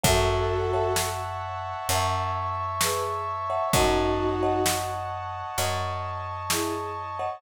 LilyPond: <<
  \new Staff \with { instrumentName = "Violin" } { \time 4/4 \key fis \minor \tempo 4 = 65 <fis' a'>4 r2 <gis' b'>16 r8. | <dis' fis'>4 r2 <e' gis'>16 r8. | }
  \new Staff \with { instrumentName = "Marimba" } { \time 4/4 \key fis \minor <cis'' e'' fis'' a''>8. <cis'' e'' fis'' a''>4~ <cis'' e'' fis'' a''>16 <cis'' e'' fis'' a''>4.~ <cis'' e'' fis'' a''>16 <cis'' e'' fis'' a''>16 | <cis'' dis'' fis'' a''>8. <cis'' dis'' fis'' a''>4~ <cis'' dis'' fis'' a''>16 <cis'' dis'' fis'' a''>4.~ <cis'' dis'' fis'' a''>16 <cis'' dis'' fis'' a''>16 | }
  \new Staff \with { instrumentName = "Electric Bass (finger)" } { \clef bass \time 4/4 \key fis \minor fis,2 fis,2 | fis,2 fis,2 | }
  \new Staff \with { instrumentName = "Brass Section" } { \time 4/4 \key fis \minor <cis'' e'' fis'' a''>2 <cis'' e'' a'' cis'''>2 | <cis'' dis'' fis'' a''>2 <cis'' dis'' a'' cis'''>2 | }
  \new DrumStaff \with { instrumentName = "Drums" } \drummode { \time 4/4 <hh bd>4 sn4 hh4 sn4 | <hh bd>4 sn4 hh4 sn4 | }
>>